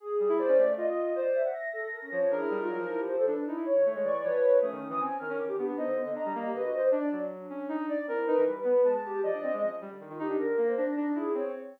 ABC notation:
X:1
M:6/8
L:1/16
Q:3/8=104
K:none
V:1 name="Ocarina"
z2 G, E z _D A,2 F4 | z10 F,2 | D E G, _E _G, F,5 D2 | _E =E z _E, A, _A, =E,2 F,4 |
A, _E, E, =E, C z _E, _D =E, _E, B, B, | _E D, D, D, D G, _B,2 D,4 | D2 _G,4 _D2 _E2 z2 | C2 _E =E, G,2 B,2 _A,4 |
F, D C _A, F, z G, D, _E, E, _E D | D,2 _B,2 D2 D2 E2 C2 |]
V:2 name="Ocarina"
_A4 c2 d2 _e4 | d2 e4 A2 _B _D _d2 | _A3 F _E2 =E G c =A B z | E2 _d4 =d2 B4 |
_D6 _B2 z G =D2 | c2 B, _e e3 G B _G c d | d2 D10 | E2 B7 B, G2 |
d2 _e2 _D2 z3 F G2 | _B3 c C2 _E2 _A2 _d2 |]
V:3 name="Clarinet"
z4 d4 z4 | c3 _g _b'8 | _B8 z4 | z6 _d'2 _d4 |
_e'3 e' _a2 f'2 d'2 z2 | _e4 _b4 e4 | z10 d2 | _B4 z4 a4 |
_e6 z6 | _b'8 z4 |]